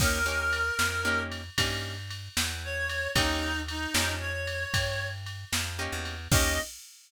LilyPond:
<<
  \new Staff \with { instrumentName = "Clarinet" } { \time 12/8 \key ees \major \tempo 4. = 76 bes'2~ bes'8 r2 r8 des''4 | ees'4 ees'4 des''2 r2 | ees''4. r1 r8 | }
  \new Staff \with { instrumentName = "Acoustic Guitar (steel)" } { \time 12/8 \key ees \major <bes des' ees' g'>8 <bes des' ees' g'>4. <bes des' ees' g'>4 <bes des' ees' g'>2. | <bes des' ees' g'>4. <bes des' ees' g'>2.~ <bes des' ees' g'>8 <bes des' ees' g'>4 | <bes des' ees' g'>4. r1 r8 | }
  \new Staff \with { instrumentName = "Electric Bass (finger)" } { \clef bass \time 12/8 \key ees \major ees,4. f,4. g,4. e,4. | ees,4. f,4. g,4. f,8. e,8. | ees,4. r1 r8 | }
  \new DrumStaff \with { instrumentName = "Drums" } \drummode { \time 12/8 <cymc bd>4 cymr8 sn4 cymr8 <bd cymr>4 cymr8 sn4 cymr8 | <bd cymr>4 cymr8 sn4 cymr8 <bd cymr>4 cymr8 sn4 cymr8 | <cymc bd>4. r4. r4. r4. | }
>>